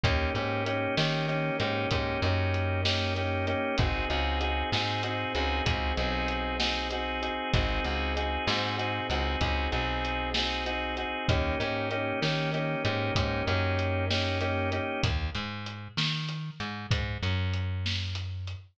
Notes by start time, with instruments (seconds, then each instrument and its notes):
0.04 electric bass (finger) D#2, drawbar organ A#3 C#4 D#4 G4, kick, closed hi-hat
0.35 electric bass (finger) G#2, drawbar organ A#3 C#4 D#4 G4, closed hi-hat
0.66 drawbar organ A#3 C#4 D#4 G4, closed hi-hat
0.97 electric bass (finger) D#3, drawbar organ A#3 C#4 D#4 G4, snare
1.28 drawbar organ A#3 C#4 D#4 G4, closed hi-hat
1.60 electric bass (finger) G#2, drawbar organ A#3 C#4 D#4 G4, closed hi-hat
1.91 electric bass (finger) G#2, drawbar organ A#3 C#4 D#4 G4, kick, closed hi-hat
2.22 electric bass (finger) F#2, drawbar organ A#3 C#4 D#4 G4, closed hi-hat
2.54 closed hi-hat
2.85 drawbar organ A#3 C#4 D#4 G4, snare
3.16 drawbar organ A#3 C#4 D#4 G4, closed hi-hat
3.47 drawbar organ A#3 C#4 D#4 G4, closed hi-hat
3.78 electric bass (finger) G#1, drawbar organ C4 D#4 F#4 G#4, kick, closed hi-hat
4.10 electric bass (finger) C#2, drawbar organ C4 D#4 F#4 G#4, closed hi-hat
4.41 drawbar organ C4 D#4 F#4 G#4, closed hi-hat
4.72 electric bass (finger) G#2, drawbar organ C4 D#4 F#4 G#4, snare
5.03 drawbar organ C4 D#4 F#4 G#4, closed hi-hat
5.35 electric bass (finger) C#2, drawbar organ C4 D#4 F#4 G#4, closed hi-hat
5.65 electric bass (finger) C#2, drawbar organ C4 D#4 F#4 G#4, kick, closed hi-hat
5.97 electric bass (finger) B1, drawbar organ C4 D#4 F#4 G#4, closed hi-hat
6.28 closed hi-hat
6.60 drawbar organ C4 D#4 F#4 G#4, snare
6.90 drawbar organ C4 D#4 F#4 G#4, closed hi-hat
7.22 drawbar organ C4 D#4 F#4 G#4, closed hi-hat
7.54 electric bass (finger) G#1, drawbar organ C4 D#4 F#4 G#4, kick, closed hi-hat
7.84 electric bass (finger) C#2, drawbar organ C4 D#4 F#4 G#4, closed hi-hat
8.17 drawbar organ C4 D#4 F#4 G#4, closed hi-hat
8.47 electric bass (finger) G#2, drawbar organ C4 D#4 F#4 G#4, snare
8.78 drawbar organ C4 D#4 F#4 G#4, closed hi-hat
9.10 electric bass (finger) C#2, drawbar organ C4 D#4 F#4 G#4, closed hi-hat
9.41 electric bass (finger) C#2, drawbar organ C4 D#4 F#4 G#4, kick, closed hi-hat
9.72 electric bass (finger) B1, drawbar organ C4 D#4 F#4 G#4, closed hi-hat
10.05 closed hi-hat
10.34 drawbar organ C4 D#4 F#4 G#4, snare
10.66 drawbar organ C4 D#4 F#4 G#4, closed hi-hat
10.97 drawbar organ C4 D#4 F#4 G#4, closed hi-hat
11.29 electric bass (finger) D#2, drawbar organ A#3 C#4 D#4 G4, kick, closed hi-hat
11.60 electric bass (finger) G#2, drawbar organ A#3 C#4 D#4 G4, closed hi-hat
11.91 drawbar organ A#3 C#4 D#4 G4, closed hi-hat
12.22 electric bass (finger) D#3, drawbar organ A#3 C#4 D#4 G4, snare
12.54 drawbar organ A#3 C#4 D#4 G4, closed hi-hat
12.85 electric bass (finger) G#2, drawbar organ A#3 C#4 D#4 G4, closed hi-hat
13.15 electric bass (finger) G#2, drawbar organ A#3 C#4 D#4 G4, kick, closed hi-hat
13.47 electric bass (finger) F#2, drawbar organ A#3 C#4 D#4 G4, closed hi-hat
13.79 closed hi-hat
14.10 drawbar organ A#3 C#4 D#4 G4, snare
14.41 drawbar organ A#3 C#4 D#4 G4, closed hi-hat
14.72 drawbar organ A#3 C#4 D#4 G4, closed hi-hat
15.03 electric bass (finger) D#2, kick, closed hi-hat
15.35 electric bass (finger) G#2, closed hi-hat
15.66 closed hi-hat
15.97 electric bass (finger) D#3, snare
16.29 closed hi-hat
16.60 electric bass (finger) G#2, closed hi-hat
16.91 electric bass (finger) G#2, kick, closed hi-hat
17.23 electric bass (finger) F#2, closed hi-hat
17.54 closed hi-hat
17.86 snare
18.15 closed hi-hat
18.47 closed hi-hat